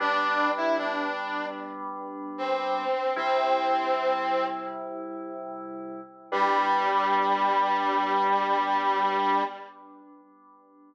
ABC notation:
X:1
M:4/4
L:1/16
Q:1/4=76
K:Gmix
V:1 name="Brass Section"
D3 E D4 z4 C4 | C8 z8 | G,16 |]
V:2 name="Electric Piano 2"
[G,B,D]16 | [C,G,E]16 | [G,B,D]16 |]